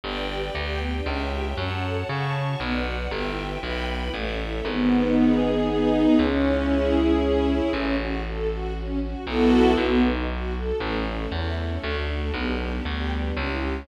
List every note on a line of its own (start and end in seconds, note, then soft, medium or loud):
0.04 0.50 G1 medium
0.04 0.15 B3 loud
0.04 0.54 B4 medium
0.04 0.54 D5 medium
0.04 0.54 G5 loud
0.16 0.28 D4 medium
0.29 0.41 G4 medium
0.43 0.55 B4 medium
0.54 1.01 D2 medium
0.54 1.07 G4 medium
0.54 1.07 B4 medium
0.54 0.66 D5 medium
0.54 1.05 G5 medium
0.67 0.79 G5 medium
0.79 0.90 B3 medium
0.93 1.05 D4 medium
1.06 1.53 C#2 medium
1.06 1.18 C#4 loud
1.06 1.57 C#5 medium
1.06 1.57 E5 medium
1.06 1.57 G5 medium
1.19 1.30 E4 medium
1.33 1.44 G4 medium
1.45 1.57 C#5 medium
1.57 2.03 F#2 medium
1.57 1.69 C#4 loud
1.57 2.08 C#5 medium
1.57 2.08 F#5 medium
1.57 2.08 A5 medium
1.71 1.82 F#4 medium
1.84 1.95 A4 medium
1.95 2.07 C#5 medium
2.09 2.55 C#3 medium
2.09 2.60 C#5 medium
2.09 2.20 F#5 medium
2.09 2.60 A5 medium
2.09 2.60 C#6 medium
2.23 2.34 A5 medium
2.35 2.46 C#4 medium
2.48 2.59 F#4 medium
2.60 3.07 B1 medium
2.60 2.73 B3 loud
2.60 3.10 B4 medium
2.60 3.11 D5 medium
2.60 3.11 F#5 medium
2.73 2.84 D4 medium
2.85 2.96 F#4 medium
2.99 3.10 B4 medium
3.11 3.57 G1 medium
3.11 3.23 B3 loud
3.11 3.62 B4 medium
3.11 3.62 E5 medium
3.11 3.62 G5 medium
3.26 3.37 E4 medium
3.37 3.48 G4 medium
3.50 3.62 B4 medium
3.62 4.09 B1 medium
3.62 4.13 B4 medium
3.62 3.74 E5 medium
3.62 4.13 G5 medium
3.62 4.13 B5 medium
3.74 3.86 G5 medium
3.89 4.01 B3 medium
4.01 4.13 E4 medium
4.13 4.61 A1 medium
4.13 4.24 A3 medium
4.13 4.65 A4 medium
4.13 4.65 C#5 medium
4.13 4.65 E5 medium
4.26 4.38 C#4 medium
4.40 4.52 E4 medium
4.54 4.65 A4 medium
4.65 6.06 G#1 loud
4.65 5.42 B3 loud
4.92 5.67 D#4 medium
5.16 5.93 G#4 medium
5.42 6.15 B3 medium
5.67 6.16 D#4 loud
5.94 6.18 G#4 medium
6.19 7.60 C#2 medium
6.19 6.95 C#4 loud
6.45 7.22 E4 medium
6.69 7.48 G#4 medium
6.96 7.69 C#4 medium
7.22 7.71 E4 medium
7.48 7.73 G#4 medium
7.73 9.15 A1 medium
7.73 7.96 C#4 loud
7.98 8.21 F#4 medium
8.25 8.48 A4 medium
8.50 8.73 F#4 medium
8.75 8.98 C#4 medium
9.02 9.25 F#4 medium
9.26 9.74 B1 medium
9.26 9.72 B3 loud
9.26 9.72 E4 loud
9.26 9.72 F#4 loud
9.26 9.72 A4 loud
9.77 10.72 B1 medium
9.77 10.01 B3 loud
10.03 10.26 D#4 medium
10.30 10.53 F#4 medium
10.56 10.79 A4 medium
10.80 11.26 A1 medium
10.80 10.92 A3 loud
10.80 11.32 A3 loud
10.80 11.32 C#4 medium
10.80 11.32 E4 medium
10.94 11.05 C#4 medium
11.07 11.19 E4 medium
11.17 11.29 A4 medium
11.32 11.78 E2 medium
11.32 11.83 A3 loud
11.32 11.83 E4 medium
11.32 11.83 A4 medium
11.32 11.44 C#5 medium
11.43 11.55 E5 medium
11.58 11.70 A3 medium
11.69 11.81 C#4 medium
11.83 12.31 D2 medium
11.83 12.34 A3 medium
11.83 11.96 A3 loud
11.83 12.34 D4 medium
11.83 12.34 F#4 medium
11.96 12.08 D4 medium
12.09 12.20 F#4 medium
12.21 12.33 A4 medium
12.33 12.80 B1 medium
12.33 12.45 B3 loud
12.33 12.84 B3 medium
12.33 12.85 D4 medium
12.33 12.84 G4 medium
12.47 12.59 D4 medium
12.60 12.71 G4 medium
12.72 12.84 B4 medium
12.84 13.32 D2 medium
12.84 13.35 G3 medium
12.84 13.35 B3 medium
12.84 13.35 G4 medium
12.84 12.97 D5 medium
12.99 13.10 G5 medium
13.12 13.24 B3 medium
13.24 13.35 D4 medium
13.36 13.84 C#2 medium
13.36 13.86 C#4 loud
13.36 13.48 C#4 loud
13.36 13.86 E4 medium
13.36 13.86 G4 medium
13.50 13.61 E4 medium
13.61 13.73 G4 medium
13.74 13.85 C#5 medium